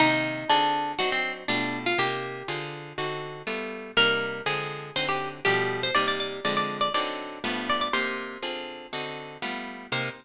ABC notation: X:1
M:4/4
L:1/16
Q:1/4=121
K:Cm
V:1 name="Acoustic Guitar (steel)"
E4 D4 ^F C2 z D3 =F | G6 z10 | B4 A4 c G2 z G3 c | d d d2 d d2 d d6 d d |
c10 z6 | c4 z12 |]
V:2 name="Acoustic Guitar (steel)"
[C,E,B,G]4 [D,CFA]4 [^F,CDE]4 [=B,,=A,=FG]4 | [C,B,E]4 [D,CFA]4 [D,CE^F]4 [G,=A,=B,=F]4 | [C,G,B,E]4 [D,F,A,C]4 [D,^F,CE]4 [=B,,=F,G,=A,]4 | [C,G,B,E]4 [D,F,A,C]4 [D,^F,CE]4 [G,,=F,=A,=B,]4 |
[C,B,EG]4 [D,CFA]4 [D,CE^F]4 [G,=A,=B,=F]4 | [C,B,EG]4 z12 |]